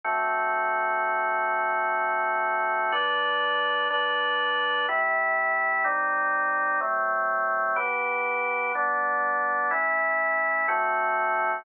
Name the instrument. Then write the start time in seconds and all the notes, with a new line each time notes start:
drawbar organ
0.04 D3 A3 C4 F#4
2.92 G3 D4 B4
3.90 G3 D4 B4
4.89 C3 A3 E4
5.84 G3 C4 D#4
6.81 F#3 A3 C4
7.76 E3 B3 G4
8.75 G3 B3 D4
9.71 A3 C#4 E4
10.68 D3 A3 C4 F#4